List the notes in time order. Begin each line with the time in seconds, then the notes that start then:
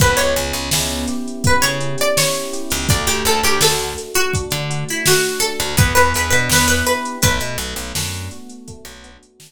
0.00 C#2 B3 B4, kick, closed hi-hat
0.17 C#2 C#5, closed hi-hat
0.36 C#2 C#4, closed hi-hat
0.53 C#2, closed hi-hat
0.71 C#2 E4, snare
0.90 closed hi-hat
1.08 G4, closed hi-hat
1.28 closed hi-hat
1.44 B3 B4, kick, closed hi-hat
1.62 C#3 C#5, closed hi-hat
1.81 C#4, closed hi-hat
1.98 D5, closed hi-hat
2.17 E4 C#5, snare
2.34 closed hi-hat
2.53 G4, closed hi-hat
2.70 C#2, open hi-hat
2.89 D2 A3 D5, kick, closed hi-hat
3.07 D2 G4, closed hi-hat
3.25 D2 D4 A4, closed hi-hat
3.43 D2 G4, closed hi-hat
3.61 D2 F#4 A4, snare
3.79 closed hi-hat
3.98 A3, closed hi-hat
4.14 F#4, closed hi-hat
4.34 D4, kick, closed hi-hat
4.51 D3, closed hi-hat
4.70 F#4, closed hi-hat
4.89 E4, closed hi-hat
5.06 A3 F#4, snare
5.24 closed hi-hat
5.40 D4 A4, closed hi-hat
5.60 D2, closed hi-hat
5.77 E2 B3 B4, kick, closed hi-hat
5.95 E2 B4, closed hi-hat
6.14 E2 D4 B4, closed hi-hat
6.30 B2 B4, closed hi-hat
6.49 E2 E4 B4, snare
6.68 B4, closed hi-hat
6.86 G4 B4, closed hi-hat
7.05 closed hi-hat
7.22 B1 A3 B4, kick, closed hi-hat
7.40 B2, closed hi-hat
7.58 B1 B3, closed hi-hat
7.76 B1, closed hi-hat
7.95 F#2 D4, snare
8.14 closed hi-hat
8.31 F#4, closed hi-hat
8.50 closed hi-hat
8.67 A3, kick, closed hi-hat
8.85 B1, closed hi-hat
9.04 B3, closed hi-hat
9.23 closed hi-hat
9.40 D4, snare